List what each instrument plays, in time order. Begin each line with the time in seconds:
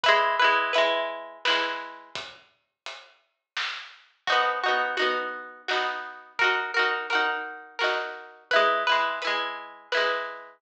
0.04 pizzicato strings E4 B4, kick, closed hi-hat
0.08 pizzicato strings G#3
0.39 pizzicato strings E4 B4
0.44 pizzicato strings G#3
0.73 pizzicato strings E4 B4, closed hi-hat
0.78 pizzicato strings G#3
1.45 pizzicato strings E4 B4, snare
1.50 pizzicato strings G#3
2.15 kick, closed hi-hat
2.86 closed hi-hat
3.57 snare
4.27 pizzicato strings D#4 F#4, kick, crash
4.32 pizzicato strings B3
4.64 pizzicato strings D#4 F#4
4.68 pizzicato strings B3
4.97 pizzicato strings D#4 F#4, closed hi-hat
5.02 pizzicato strings B3
5.68 pizzicato strings D#4 F#4, snare
5.73 pizzicato strings B3
6.39 pizzicato strings F#4 A#4, kick, closed hi-hat
6.44 pizzicato strings D#4
6.74 pizzicato strings F#4 A#4
6.79 pizzicato strings D#4
7.10 pizzicato strings F#4 A#4, closed hi-hat
7.15 pizzicato strings D#4
7.79 pizzicato strings F#4 A#4, snare
7.84 pizzicato strings D#4
8.51 pizzicato strings E4 B4, kick, closed hi-hat
8.56 pizzicato strings G#3
8.87 pizzicato strings E4 B4
8.92 pizzicato strings G#3
9.22 pizzicato strings E4 B4, closed hi-hat
9.27 pizzicato strings G#3
9.92 pizzicato strings E4 B4, snare
9.97 pizzicato strings G#3